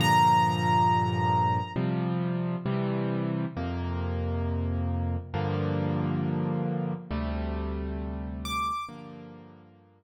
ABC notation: X:1
M:4/4
L:1/8
Q:1/4=135
K:Gm
V:1 name="Acoustic Grand Piano"
b8 | z8 | z8 | z8 |
z6 d'2 | z8 |]
V:2 name="Acoustic Grand Piano"
[G,,B,,D,F,]8 | [C,F,G,]4 [C,=E,G,]4 | [F,,C,B,]8 | [G,,D,F,B,]8 |
[D,,C,G,A,]8 | [G,,D,F,B,]8 |]